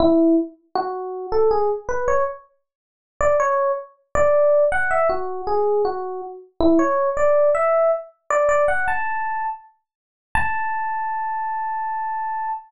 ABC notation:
X:1
M:9/8
L:1/8
Q:3/8=106
K:A
V:1 name="Electric Piano 1"
E2 z2 F3 A G | z B c z5 d | c2 z2 d3 f e | F2 G2 F2 z2 E |
c2 d2 e2 z2 d | "^rit." d f a3 z4 | a9 |]